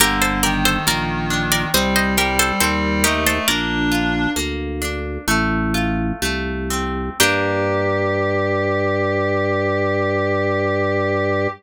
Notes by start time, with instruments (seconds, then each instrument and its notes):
0.00 drawbar organ G1, clarinet D3, orchestral harp A#3, harpsichord G4 A#4
0.22 harpsichord A4 C5
0.43 clarinet D#3, orchestral harp G4, harpsichord A#4 D5
0.65 harpsichord A4 C5
0.87 drawbar organ A#1, orchestral harp A#3, harpsichord A#4 D5
1.30 orchestral harp D4
1.52 harpsichord A#4 D5
1.74 drawbar organ C2, clarinet G3, orchestral harp C4, harpsichord C5 D#5
1.96 harpsichord C5 D#5
2.17 clarinet G3, orchestral harp G4, harpsichord G4 A#4
2.39 harpsichord A4 C5
2.61 drawbar organ D#2, clarinet G3, orchestral harp C4, harpsichord A4 C5
3.04 clarinet A3, orchestral harp D#4, harpsichord G4 A#4
3.26 clarinet A3, harpsichord A4 C5
3.48 drawbar organ A#1, orchestral harp A#3, clarinet D4, harpsichord A#4 D5
3.92 orchestral harp F4
4.36 drawbar organ D2, orchestral harp A#3
4.82 orchestral harp D4
5.28 drawbar organ A1, orchestral harp A3
5.74 orchestral harp F4
6.22 drawbar organ C2, orchestral harp A3
6.70 orchestral harp C4
7.20 drawbar organ G2, orchestral harp A#3 D4 G4, clarinet G4, harpsichord G5